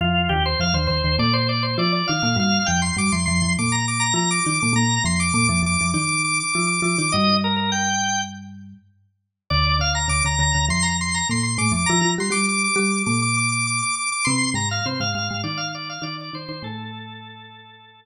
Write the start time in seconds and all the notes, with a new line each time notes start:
0.01 F2 F3 F4
0.29 D#2 D#3 G4
0.46 C5
0.60 F2 F3 F5
0.74 D#2 D#3 C5
0.87 D#2 D#3 C5
1.04 D#2 D#3
1.19 A#2 A#3 D5
1.33 C5
1.49 D5
1.63 C5
1.78 F3 F4 D5
1.92 D5
2.08 D#3 D#4 F5
2.22 A#2 A#3 F5
2.36 G2 G3 F5
2.66 F2 F3 G5
2.82 C6
2.97 G2 G3 D6
3.12 F2 F3 C6
3.26 F2 F3 C6
3.42 F2 F3
3.59 A#2 A#3 D6
3.72 A#5
3.88 D6
4.00 A#5
4.14 F3 F4 A#5
4.31 D6
4.45 D#3 D#4 D6
4.60 A#2 A#3 D6
4.73 A#2 A#3 A#5
5.04 F2 F3 C6
5.20 D6
5.34 A#2 A#3 D6
5.47 F2 F3 D6
5.63 F2 F3 D6
5.81 F2 F3
5.94 D#3 D#4 D6
6.09 D6
6.24 D6
6.40 D6
6.53 F3 F4 D6
6.67 D6
6.82 F3 F4 D6
6.98 D#3 D#4 D6
7.12 G2 G3 D#5
7.44 A#4
7.56 A#4
7.72 G5
9.50 D2 D3 D5
9.79 D2 D3 F5
9.95 A#5
10.08 D2 D3 D6
10.25 D2 D3 A#5
10.39 D2 D3 A#5
10.54 D2 D3
10.69 F2 F3 C6
10.83 A#5
11.01 C6
11.14 A#5
11.29 A#2 A#3 C6
11.43 C6
11.58 A2 A3 D6
11.72 F2 F3 D6
11.86 F3 F4 A#5
12.01 F3 F4
12.18 G3 G4 C6
12.30 G3 G4 D6
12.49 D6
12.64 D6
12.76 G3 G4 D6
13.06 A#2 A#3 D6
13.22 D6
13.37 D6
13.52 D6
13.67 D6
13.82 D6
13.96 D6
14.12 D6
14.25 C3 C4 C6
14.54 G#2 G#3 A#5
14.71 F5
14.86 C3 C4 C5
15.00 G#2 G#3 F5
15.15 G#2 G#3 F5
15.31 G#2 G#3
15.44 D#3 D#4 D5
15.57 F5
15.75 D5
15.89 F5
16.02 D#3 D#4 D5
16.21 D5
16.33 D#3 D#4 C5
16.49 D#3 D#4 C5
16.62 A2 A3 A4